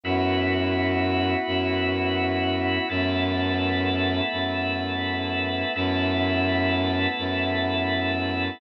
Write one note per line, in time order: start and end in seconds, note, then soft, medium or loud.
0.03 1.35 F#2 loud
0.03 2.86 B3 medium
0.03 2.86 E4 medium
0.03 2.87 E4 medium
0.03 2.86 F#4 medium
0.03 2.87 F#4 medium
0.03 2.87 B4 medium
1.47 2.78 F#2 loud
2.89 4.21 F#2 loud
2.89 5.72 A3 medium
2.89 5.72 B3 medium
2.89 5.72 E4 medium
2.89 5.72 A4 medium
2.89 5.72 B4 medium
4.32 5.64 F#2 medium
5.75 7.07 F#2 loud
5.75 8.58 A3 medium
5.75 8.58 B3 medium
5.75 8.58 E4 medium
5.75 8.58 A4 medium
5.75 8.58 B4 medium
7.18 8.50 F#2 medium